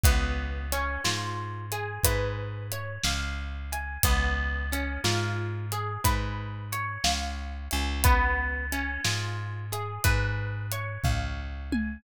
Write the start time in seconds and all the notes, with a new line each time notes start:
0.04 C#2 B3, kick, closed hi-hat
0.72 C#4, closed hi-hat
1.05 G#2 F4, snare
1.72 G#4, closed hi-hat
2.04 G#2 B4, kick, closed hi-hat
2.72 C#5, closed hi-hat
3.04 C#2 F5, snare
3.73 G#5, closed hi-hat
4.03 C#2 B3, kick, closed hi-hat
4.72 C#4, closed hi-hat
5.04 G#2 F4, snare
5.72 G#4, closed hi-hat
6.04 G#2 B4, kick, closed hi-hat
6.72 C#5, closed hi-hat
7.04 C#2 F5, snare
7.71 C#2 G#5, closed hi-hat
8.04 B3, kick, closed hi-hat
8.72 C#4, closed hi-hat
9.05 G#2 F4, snare
9.72 G#4, closed hi-hat
10.04 G#2 B4, kick, closed hi-hat
10.72 C#5, closed hi-hat
11.04 C#2 F5, kick, floor tom
11.72 G#5, high tom